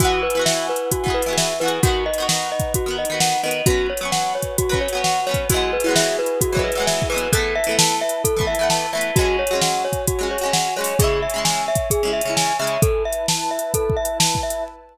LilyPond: <<
  \new Staff \with { instrumentName = "Glockenspiel" } { \time 4/4 \key e \lydian \tempo 4 = 131 fis'8 b'8 e''8 b'8 fis'8 b'8 e''8 b'8 | fis'8 dis''8 fis''8 dis''8 fis'8 dis''8 fis''8 dis''8 | fis'8 cis''8 fis''8 cis''8 fis'8 cis''8 fis''8 cis''8 | fis'8 b'8 e''8 b'8 fis'8 b'8 e''8 b'8 |
a'8 e''8 a''8 e''8 a'8 e''8 a''8 e''8 | fis'8 cis''8 fis''8 cis''8 fis'8 cis''8 fis''8 cis''8 | gis'8 e''8 gis''8 e''8 gis'8 e''8 gis''8 e''8 | a'8 e''8 a''8 e''8 a'8 e''8 a''8 e''8 | }
  \new Staff \with { instrumentName = "Pizzicato Strings" } { \time 4/4 \key e \lydian <e b fis' gis'>8. <e b fis' gis'>4. <e b fis' gis'>8 <e b fis' gis'>8. <e b fis' gis'>8 | <dis b fis'>8. <dis b fis'>4. <dis b fis'>8 <dis b fis'>8. <dis b fis'>8 | <fis b cis'>8. <fis b cis'>4. <fis b cis'>8 <fis b cis'>8. <fis b cis'>8 | <e fis gis b>8. <e fis gis b>4. <e fis gis b>8 <e fis gis b>8. <e fis gis b>8 |
<e a b>8. <e a b>4. <e a b>8 <e a b>8. <e a b>8 | <fis gis cis'>8. <fis gis cis'>4. <fis gis cis'>8 <fis gis cis'>8. <fis gis cis'>8 | <cis gis e'>8. <cis gis e'>4. <cis gis e'>8 <cis gis e'>8. <cis gis e'>8 | r1 | }
  \new Staff \with { instrumentName = "Pad 5 (bowed)" } { \time 4/4 \key e \lydian <e' b' fis'' gis''>1 | <dis' b' fis''>1 | <fis' b' cis''>1 | <e' fis' gis' b'>1 |
<e' b' a''>1 | <fis' cis'' gis''>1 | <cis'' e'' gis''>1 | <e' b' a''>1 | }
  \new DrumStaff \with { instrumentName = "Drums" } \drummode { \time 4/4 \tuplet 3/2 { <hh bd>8 r8 hh8 sn8 r8 hh8 <hh bd>8 bd8 hh8 sn8 r8 hh8 } | \tuplet 3/2 { <hh bd>8 r8 hh8 sn8 r8 <bd hh>8 <hh bd>8 r8 hh8 sn8 r8 hh8 } | \tuplet 3/2 { <hh bd>8 r8 hh8 sn8 r8 <hh bd>8 <hh bd>8 bd8 hh8 sn8 r8 <hh bd>8 } | \tuplet 3/2 { <hh bd>8 r8 hh8 sn8 r8 hh8 <hh bd>8 bd8 hh8 sn8 bd8 hh8 } |
\tuplet 3/2 { <hh bd>8 r8 hh8 sn8 r8 hh8 <hh bd>8 bd8 hh8 sn8 r8 hh8 } | \tuplet 3/2 { <hh bd>8 r8 hh8 sn8 r8 <hh bd>8 <hh bd>8 r8 hh8 sn8 r8 hho8 } | \tuplet 3/2 { <hh bd>8 r8 hh8 sn8 r8 <hh bd>8 <hh bd>8 r8 hh8 sn8 r8 hh8 } | \tuplet 3/2 { <hh bd>8 r8 hh8 sn8 r8 hh8 <hh bd>8 bd8 hh8 sn8 bd8 hh8 } | }
>>